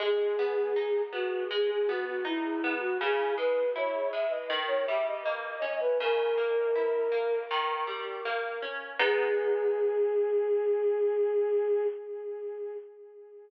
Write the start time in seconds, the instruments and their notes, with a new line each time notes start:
0.00 orchestral harp G#3, flute G#4
0.39 orchestral harp B3
0.76 orchestral harp D#4
1.12 orchestral harp B3, flute F#4
1.50 orchestral harp G#3, flute G#4
1.70 flute G#4
1.87 orchestral harp B3, flute F#4
2.06 flute F#4
2.25 orchestral harp D#4, flute E4
2.64 orchestral harp B3
2.80 flute F#4
3.00 orchestral harp C#3, flute G#4
3.37 orchestral harp G#3, flute B4
3.76 orchestral harp E4, flute C#5
4.12 orchestral harp G#3, flute E5
4.30 flute D#5
4.50 orchestral harp D#3
4.68 flute C#5
4.87 orchestral harp G3, flute E5
5.08 flute D#5
5.25 orchestral harp A#3, flute D#5
5.62 orchestral harp C#4
5.80 flute B4
6.00 orchestral harp C#3, flute A#4
6.38 orchestral harp A#3
6.75 orchestral harp E4
7.12 orchestral harp A#3
7.51 orchestral harp D#3
7.87 orchestral harp G3
8.25 orchestral harp A#3
8.62 orchestral harp C#4
8.99 orchestral harp G#3 B3 D#4, flute G#4